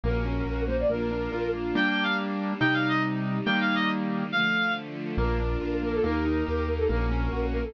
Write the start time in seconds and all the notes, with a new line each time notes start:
0.03 A#1 A#3 C#4 F#4 A#4
0.25 C#4
0.45 A#1 F#4
0.67 A#3 C5
0.80 D5
0.89 A#1 A#3 D4 F4 A#4
1.11 D4
1.32 A#1 F4
1.54 A#3
1.75 G3 A#3 D4 G5
1.90 G5
2.03 F5
2.60 C3 G3 D#4 G5
2.74 F5
2.88 D#5
3.46 D#3 G3 A#3 G5
3.61 F5
3.75 D#5
4.31 D3 F3 A3 F5
5.17 A#1 A#3 D4 F4 A#4
5.40 D4
5.61 A#1 F4
5.82 A#3 A#4
5.94 A4
6.02 D#2 A#3 D#4 G4 A#4
6.25 D#4
6.46 D#2 G4
6.68 A#3 A#4
6.78 A4
6.89 A#1 A#3 C#4 F#4 A#4
7.11 C#4
7.32 A#1 F#4
7.52 A#3 A#4
7.63 A4